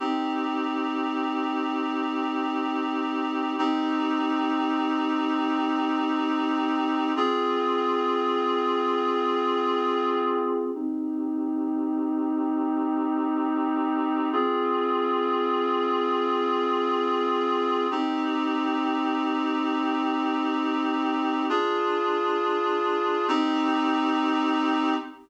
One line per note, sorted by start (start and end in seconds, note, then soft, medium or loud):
0.00 3.55 C4 medium
0.00 3.55 D#4 medium
0.00 3.55 G4 medium
3.58 7.13 C4 medium
3.58 7.13 D#4 medium
3.58 7.13 G4 medium
7.16 10.71 C4 medium
7.16 10.71 F4 medium
7.16 10.71 G#4 medium
10.75 14.29 C4 medium
10.75 14.29 D#4 medium
10.75 14.29 G4 medium
14.33 17.87 C4 medium
14.33 17.87 F4 medium
14.33 17.87 G#4 medium
17.91 21.46 C4 medium
17.91 21.46 D#4 medium
17.91 21.46 G4 medium
21.49 23.27 D4 medium
21.49 23.27 F4 medium
21.49 23.27 G#4 medium
23.28 24.94 C4 loud
23.28 24.94 D#4 loud
23.28 24.94 G4 medium